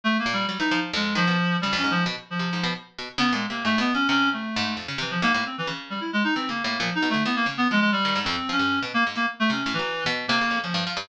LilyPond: <<
  \new Staff \with { instrumentName = "Clarinet" } { \time 7/8 \tempo 4 = 133 \tuplet 3/2 { a8 ais8 g8 } g16 dis'8 r16 gis8 f4 | \tuplet 3/2 { g8 cis'8 f8 } r8 f4 r4 | \tuplet 3/2 { b8 gis8 ais8 a8 b8 cis'8 } cis'8 a4 | r8 e16 f16 ais16 ais16 c'16 e16 r8 g16 e'16 gis16 dis'16 |
\tuplet 3/2 { c'8 ais8 ais8 f8 dis'8 a8 } b16 ais16 r16 b16 gis16 gis16 | \tuplet 3/2 { g4 c'4 cis'4 } r16 ais16 r16 ais16 r16 a16 | cis'8 e8. r8 ais8. f8 r8 | }
  \new Staff \with { instrumentName = "Harpsichord" } { \clef bass \time 7/8 r8 ais,8 fis16 e16 f8 f,8 dis16 b,16 r8 | cis16 f,16 gis,8 b,16 r8 c16 gis,16 b,16 r8 b,16 r16 | \tuplet 3/2 { cis8 ais,8 c8 gis,8 b,8 fis8 } c4 gis,8 | f,16 cis16 c8 gis,16 a,16 r8 cis4. |
\tuplet 3/2 { e8 cis8 a,8 } ais,16 r16 b,16 d16 e8 cis8 f8 | r16 dis16 gis,16 f,16 r16 f16 g,8 b,16 r16 gis,16 e16 r8 | \tuplet 3/2 { c8 a,8 fis8 } r16 b,8 c16 cis16 f,16 cis16 g,16 f16 g,16 | }
>>